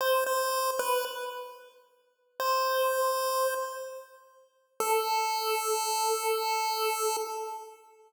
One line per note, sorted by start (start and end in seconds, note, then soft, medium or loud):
0.01 0.24 C5 loud
0.26 0.71 C5 medium
0.79 1.05 B4 medium
2.40 3.54 C5 medium
4.80 7.17 A4 loud